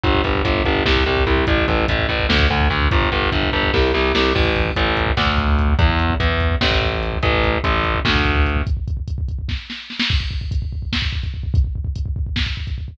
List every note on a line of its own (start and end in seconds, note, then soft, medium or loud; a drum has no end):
0.04 0.21 G1 loud
0.04 kick loud
0.04 closed hi-hat loud
0.15 kick loud
0.24 0.42 G1 medium
0.24 kick loud
0.24 closed hi-hat medium
0.35 kick loud
0.45 0.62 G1 medium
0.45 kick loud
0.45 closed hi-hat loud
0.55 kick medium
0.64 0.83 G1 medium
0.64 kick loud
0.64 closed hi-hat medium
0.75 kick medium
0.86 1.03 C2 loud
0.86 kick loud
0.86 snare loud
0.96 kick medium
1.06 1.24 C2 medium
1.06 kick medium
1.06 closed hi-hat medium
1.17 kick medium
1.27 1.44 C2 medium
1.27 kick loud
1.27 closed hi-hat loud
1.37 kick medium
1.47 1.65 A1 loud
1.47 kick loud
1.47 closed hi-hat loud
1.58 kick loud
1.68 1.86 A1 medium
1.68 kick loud
1.68 closed hi-hat medium
1.78 kick medium
1.88 2.07 A1 medium
1.88 kick loud
1.88 closed hi-hat loud
1.99 kick medium
2.09 2.26 A1 medium
2.09 kick medium
2.09 closed hi-hat medium
2.19 kick loud
2.29 2.47 D2 loud
2.29 kick medium
2.29 snare loud
2.39 kick loud
2.50 2.68 D2 medium
2.50 kick medium
2.50 closed hi-hat medium
2.60 kick medium
2.70 2.88 D2 medium
2.70 kick medium
2.70 closed hi-hat medium
2.81 kick medium
2.91 3.09 G1 medium
2.91 kick loud
2.91 closed hi-hat loud
3.02 kick loud
3.12 3.29 G1 loud
3.12 kick medium
3.12 closed hi-hat medium
3.22 kick medium
3.32 3.50 G1 medium
3.32 kick loud
3.32 closed hi-hat loud
3.43 kick medium
3.52 3.70 G1 loud
3.52 kick medium
3.52 closed hi-hat medium
3.63 kick loud
3.74 3.91 C2 loud
3.74 kick loud
3.74 snare loud
3.94 4.12 C2 loud
3.94 snare medium
4.15 4.32 C2 medium
4.15 snare loud
4.35 4.70 A1 loud
4.35 kick loud
4.35 crash loud
4.45 kick loud
4.56 kick loud
4.56 closed hi-hat medium
4.66 kick medium
4.76 5.11 A1 loud
4.76 kick loud
4.76 closed hi-hat loud
4.86 kick medium
4.97 kick medium
4.97 closed hi-hat medium
5.06 kick loud
5.17 5.74 D2 loud
5.17 kick loud
5.17 snare loud
5.27 kick loud
5.38 kick loud
5.38 closed hi-hat medium
5.48 kick medium
5.59 kick loud
5.59 closed hi-hat medium
5.69 kick medium
5.79 6.14 E2 loud
5.79 kick loud
5.79 closed hi-hat loud
5.90 kick medium
5.99 kick medium
5.99 closed hi-hat medium
6.10 kick loud
6.20 6.55 E2 medium
6.20 kick loud
6.20 closed hi-hat loud
6.30 kick medium
6.40 kick medium
6.40 closed hi-hat medium
6.51 kick medium
6.61 7.18 A1 loud
6.61 kick loud
6.61 snare loud
6.71 kick loud
6.81 kick loud
6.81 closed hi-hat medium
6.92 kick medium
7.02 kick medium
7.02 closed hi-hat medium
7.13 kick medium
7.23 7.58 A1 loud
7.23 kick loud
7.23 closed hi-hat loud
7.33 kick medium
7.44 kick loud
7.44 closed hi-hat medium
7.54 kick medium
7.64 7.99 A1 loud
7.64 kick loud
7.64 closed hi-hat loud
7.74 kick medium
7.84 kick medium
7.84 closed hi-hat medium
7.95 kick loud
8.05 8.62 D2 loud
8.05 kick loud
8.05 snare loud
8.16 kick loud
8.25 kick loud
8.25 closed hi-hat medium
8.36 kick loud
8.46 kick medium
8.46 closed hi-hat medium
8.57 kick loud
8.67 kick loud
8.67 closed hi-hat loud
8.77 kick medium
8.88 kick loud
8.88 closed hi-hat medium
8.97 kick medium
9.08 kick loud
9.08 closed hi-hat loud
9.18 kick loud
9.29 kick medium
9.29 closed hi-hat medium
9.39 kick medium
9.49 kick loud
9.49 snare medium
9.70 snare medium
9.90 snare medium
10.00 snare loud
10.10 kick loud
10.10 crash loud
10.20 kick medium
10.31 kick loud
10.41 kick medium
10.51 kick loud
10.51 closed hi-hat loud
10.62 kick medium
10.73 kick medium
10.82 kick medium
10.93 kick medium
10.93 snare loud
11.02 kick loud
11.13 kick loud
11.23 kick loud
11.23 closed hi-hat medium
11.34 kick medium
11.43 kick medium
11.54 kick loud
11.54 closed hi-hat loud
11.64 kick medium
11.76 kick medium
11.85 kick loud
11.96 kick loud
11.96 closed hi-hat loud
12.06 kick loud
12.16 kick loud
12.27 kick medium
12.36 kick loud
12.36 snare loud
12.46 kick medium
12.57 kick medium
12.67 kick medium
12.67 closed hi-hat medium
12.78 kick medium
12.88 kick loud